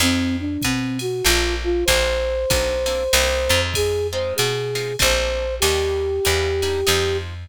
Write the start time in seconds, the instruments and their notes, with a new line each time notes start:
0.00 electric bass (finger) F2, acoustic guitar (steel) C4 D#4 F4 G#4, flute C4, ride
0.40 flute D4
0.62 electric bass (finger) B2, flute C4, kick, hi-hat pedal, ride
0.99 flute F#4, ride
1.25 electric bass (finger) A#1, acoustic guitar (steel) A#3 C4 D4 A4, flute F4, ride
1.64 flute F4
1.85 electric bass (finger) A#1, acoustic guitar (steel) A#3 C4 D4 A4, flute C5, kick, ride
2.50 electric bass (finger) B1, acoustic guitar (steel) A#3 C4 D4 A4, kick, hi-hat pedal, ride
2.86 acoustic guitar (steel) A#3 C4 D4 A4, ride
3.13 electric bass (finger) C2, acoustic guitar (steel) A#3 C4 D4 D#4, ride
3.49 electric bass (finger) F2, acoustic guitar (steel) G#3 C4 D#4 F4
3.74 flute G#4, kick, ride
4.12 acoustic guitar (steel) G#3 C4 D#4 F4, flute C5
4.36 electric bass (finger) B2, flute G#4, hi-hat pedal, ride
4.75 acoustic guitar (steel) G#3 C4 D#4 F4, ride
4.99 electric bass (finger) A#1, acoustic guitar (steel) A3 A#3 C4 D4, flute C5, kick, ride
5.60 electric bass (finger) D#2, acoustic guitar (steel) G3 A#3 D4 D#4, flute G4, ride
6.25 electric bass (finger) E2, acoustic guitar (steel) G3 A#3 D4 D#4, hi-hat pedal, ride
6.62 acoustic guitar (steel) G3 A#3 D4 D#4, ride
6.87 electric bass (finger) F2, acoustic guitar (steel) F3 G#3 C4 D#4, ride